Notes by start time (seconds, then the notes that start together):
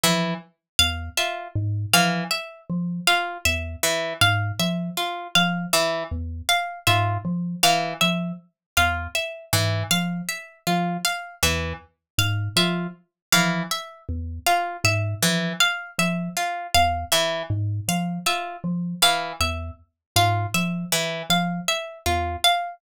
0.04 E3 F3 E5
0.79 E2 F5
1.17 F4 E5
1.56 G#2
1.94 E3 F3 F5
2.31 E5
2.70 F3
3.07 F4 F5
3.45 E2 E5
3.83 E3
4.21 G#2 F5
4.59 F3 E5
4.97 F4
5.35 F3 F5
5.73 E3 E5
6.11 E2
6.49 F5
6.87 G#2 F4 E5
7.25 F3
7.63 E3 F5
8.01 F3 E5
8.77 E2 F4 F5
9.15 E5
9.53 G#2 E3
9.91 F3 F5
10.29 E5
10.67 F3 F4
11.05 F5
11.43 E2 E3 E5
12.18 G#2 F5
12.56 F3 F4 E5
13.32 E3 F3 F5
13.71 E5
14.09 E2
14.47 F4 F5
14.84 G#2 E5
15.22 E3 F3
15.60 F5
15.99 F3 E5
16.37 F4
16.75 E2 F5
17.12 E3 E5
17.50 G#2
17.88 F3 F5
18.26 F4 E5
18.64 F3
19.02 E3 F5
19.40 E2 E5
20.16 G#2 F4 F5
20.54 F3 E5
20.92 E3
21.30 F3 F5
21.68 E5
22.06 E2 F4
22.44 F5